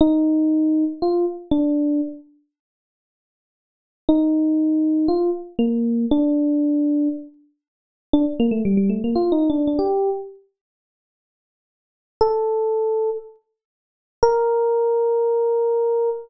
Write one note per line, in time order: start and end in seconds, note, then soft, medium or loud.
0.01 0.84 D#4 loud
1.02 1.25 F4 medium
1.51 2.01 D4 medium
4.09 5.07 D#4 medium
5.08 5.30 F4 medium
5.59 6.06 A#3 medium
6.11 7.08 D4 loud
8.13 8.25 D4 medium
8.40 8.52 A#3 loud
8.51 8.63 A3 medium
8.65 8.77 G3 medium
8.77 8.89 G3 medium
8.90 9.02 A3 medium
9.04 9.16 A#3 medium
9.15 9.32 F4 medium
9.32 9.48 D#4 medium
9.50 9.66 D4 medium
9.67 9.79 D4 medium
9.79 10.10 G4 medium
12.21 13.10 A4 medium
14.23 16.10 A#4 loud